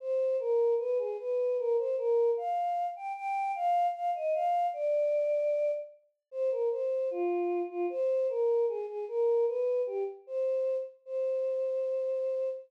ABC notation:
X:1
M:2/2
L:1/8
Q:1/2=76
K:Cm
V:1 name="Choir Aahs"
c2 B2 =B A B2 | B c B2 f3 g | g2 f2 f e f2 | d6 z2 |
c B c2 F3 F | c2 B2 A A B2 | =B2 G z c3 z | c8 |]